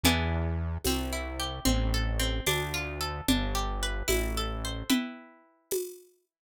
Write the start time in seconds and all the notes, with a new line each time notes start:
0.03 E2 B3 D4 E4 G#4, low conga
0.84 C2 C4, tambourine, high conga
1.13 E4
1.40 G4
1.65 A1 C4, low conga
1.94 A4
2.19 C4
2.46 D2 D4, tambourine, high conga
2.74 F4
3.01 A4
3.28 G1 D4, low conga
3.55 G4
3.83 B4
4.08 A1 E4, tambourine, high conga
4.37 A4
4.65 C5
4.90 E4 B4 G5, low conga
5.71 tambourine, high conga